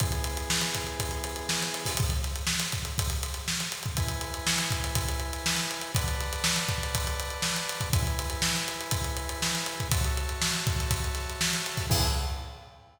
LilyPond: <<
  \new Staff \with { instrumentName = "Drawbar Organ" } { \time 4/4 \key e \mixolydian \tempo 4 = 121 <e b gis'>1 | r1 | <e' b' gis''>1 | <b' d'' fis'' a''>1 |
<e' b' gis''>1 | <fis' cis'' e'' a''>1 | <e b gis'>4 r2. | }
  \new DrumStaff \with { instrumentName = "Drums" } \drummode { \time 4/4 <hh bd>16 hh16 hh16 hh16 sn16 <hh sn>16 <hh bd sn>16 hh16 <hh bd>16 <hh sn>16 hh16 hh16 sn16 <hh sn>16 hh16 <hho bd>16 | <hh bd>16 <hh sn>16 <hh sn>16 hh16 sn16 <hh sn>16 <hh bd sn>16 hh16 <hh bd>16 hh16 hh16 <hh sn>16 sn16 hh16 hh16 <hh bd>16 | <hh bd>16 hh16 hh16 hh16 sn16 <hh sn>16 <hh bd>16 hh16 <hh bd>16 hh16 hh16 hh16 sn16 hh16 hh16 hh16 | <hh bd>16 hh16 <hh sn>16 hh16 sn16 hh16 <hh bd>16 <hh sn>16 <hh bd>16 hh16 hh16 hh16 sn16 hh16 hh16 <hh bd>16 |
<hh bd>16 hh16 hh16 hh16 sn16 <hh sn>16 hh16 hh16 <hh bd>16 hh16 hh16 hh16 sn16 hh16 hh16 <hh bd>16 | <hh bd>16 hh16 hh16 hh16 sn16 hh16 <hh bd>16 <hh sn>16 <hh bd>16 hh16 <hh sn>16 hh16 sn16 hh16 hh16 <hho bd sn>16 | <cymc bd>4 r4 r4 r4 | }
>>